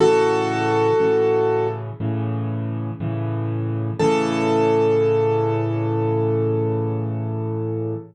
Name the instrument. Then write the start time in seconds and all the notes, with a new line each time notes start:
acoustic grand piano
0.00 A2 C#3 E3 F#4 A4
1.00 A2 C#3 E3
2.00 A2 C#3 E3
3.00 A2 C#3 E3
3.99 A2 C#3 E3 A4